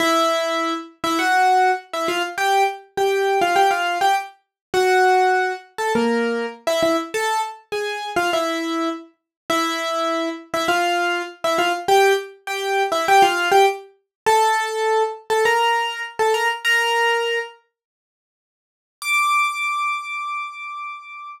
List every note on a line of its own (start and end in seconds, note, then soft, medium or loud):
0.00 0.74 E4 medium
0.00 0.74 E5 loud
1.04 1.18 E4 medium
1.04 1.18 E5 medium
1.19 1.71 F#4 medium
1.19 1.71 F#5 medium
1.93 2.08 E4 medium
1.93 2.08 E5 medium
2.08 2.22 F4 medium
2.08 2.22 F5 medium
2.38 2.63 G4 medium
2.38 2.63 G5 medium
2.97 3.39 G4 medium
2.97 3.39 G5 medium
3.41 3.56 F4 medium
3.41 3.56 F5 medium
3.56 3.70 G4 medium
3.56 3.70 G5 medium
3.71 3.98 F4 medium
3.71 3.98 F5 medium
4.01 4.15 G4 medium
4.01 4.15 G5 medium
4.74 5.53 F#4 medium
4.74 5.53 F#5 medium
5.78 5.92 A4 medium
5.78 5.92 A5 medium
5.95 6.46 A#3 medium
5.95 6.46 A#4 medium
6.67 6.81 E4 medium
6.67 6.81 E5 loud
6.83 6.97 E4 medium
6.83 6.97 E5 medium
7.14 7.41 A4 medium
7.14 7.41 A5 medium
7.72 8.09 G#4 medium
7.72 8.09 G#5 medium
8.16 8.30 F4 medium
8.16 8.30 F5 medium
8.33 8.89 E4 medium
8.33 8.89 E5 medium
9.50 10.29 E4 medium
9.50 10.29 E5 loud
10.54 10.68 E4 medium
10.54 10.68 E5 medium
10.68 11.22 F4 medium
10.68 11.22 F5 medium
11.44 11.58 E4 medium
11.44 11.58 E5 medium
11.58 11.72 F4 medium
11.58 11.72 F5 medium
11.88 12.13 G4 medium
11.88 12.13 G5 loud
12.47 12.83 G4 medium
12.47 12.83 G5 medium
12.92 13.06 E4 medium
12.92 13.06 E5 medium
13.08 13.22 G4 medium
13.08 13.22 G5 loud
13.22 13.49 F4 medium
13.22 13.49 F5 medium
13.51 13.66 G4 medium
13.51 13.66 G5 medium
14.26 15.03 A4 medium
14.26 15.03 A5 loud
15.30 15.44 A4 medium
15.30 15.44 A5 medium
15.45 16.02 A#4 medium
15.45 16.02 A#5 medium
16.19 16.33 A4 medium
16.19 16.33 A5 medium
16.34 16.48 A#4 medium
16.34 16.48 A#5 medium
16.65 17.39 A#4 medium
16.65 17.39 A#5 medium
19.02 21.29 D6 loud